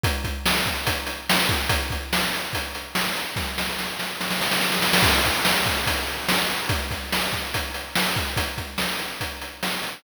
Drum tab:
CC |----------------|----------------|----------------|x---------------|
HH |x-x---x-x-x---x-|x-x---x-x-x---x-|----------------|--x---x-x-x---x-|
SD |----o-------o---|----o-------o---|o-o-o-o-oooooooo|----o-------o---|
BD |o-o---o-o-----o-|o-o-----o-------|o---------------|o-o---o-o-------|

CC |----------------|----------------|
HH |x-x---x-x-x---x-|x-x---x-x-x---x-|
SD |----o-------o---|----o-------o---|
BD |o-o---o-o-----o-|o-o-----o-------|